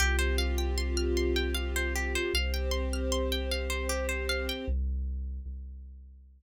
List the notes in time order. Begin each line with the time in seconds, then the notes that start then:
0.00 C2 C4 F4 G4
0.19 C5
0.38 F5
0.58 G5
0.78 C6
0.97 F6
1.17 C6
1.36 G5
1.55 F5
1.76 C5
1.95 G4
2.15 C5
2.34 C2 C4 G4 C5 F5
2.54 G5
2.71 C6
2.93 F6
3.12 C6
3.32 G5
3.51 F5
3.70 C5
3.89 G4
4.09 C5
4.29 F5
4.49 G5
4.68 C2
5.46 C2